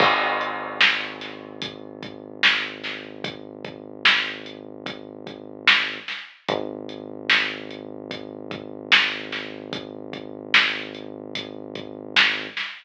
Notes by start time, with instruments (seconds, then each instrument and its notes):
0.00 synth bass 1 G#1, kick, crash
0.41 closed hi-hat
0.81 snare
1.21 snare, closed hi-hat
1.62 kick, closed hi-hat
2.03 kick, closed hi-hat
2.43 snare
2.84 snare, closed hi-hat
3.24 kick, closed hi-hat
3.65 kick, closed hi-hat
4.05 snare
4.46 closed hi-hat
4.86 kick, closed hi-hat
5.27 kick, closed hi-hat
5.67 snare
6.08 snare, closed hi-hat
6.48 synth bass 1 G#1, kick, closed hi-hat
6.89 closed hi-hat
7.30 snare
7.71 closed hi-hat
8.11 kick, closed hi-hat
8.51 kick, closed hi-hat
8.92 snare
9.32 snare, closed hi-hat
9.73 kick, closed hi-hat
10.13 kick, closed hi-hat
10.54 snare
10.95 closed hi-hat
11.35 kick, closed hi-hat
11.75 kick, closed hi-hat
12.16 snare
12.57 snare, closed hi-hat